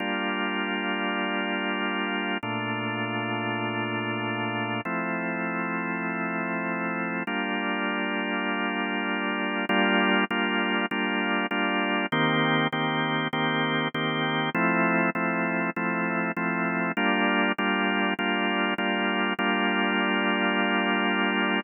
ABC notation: X:1
M:4/4
L:1/8
Q:"Swing 16ths" 1/4=99
K:Gm
V:1 name="Drawbar Organ"
[G,B,DF]8 | [B,,A,DF]8 | [F,A,C=E]8 | [G,B,DF]8 |
[G,B,DF]2 [G,B,DF]2 [G,B,DF]2 [G,B,DF]2 | [E,B,CG]2 [E,B,CG]2 [E,B,CG]2 [E,B,CG]2 | [F,A,C=E]2 [F,A,CE]2 [F,A,CE]2 [F,A,CE]2 | [G,B,DF]2 [G,B,DF]2 [G,B,DF]2 [G,B,DF]2 |
[G,B,DF]8 |]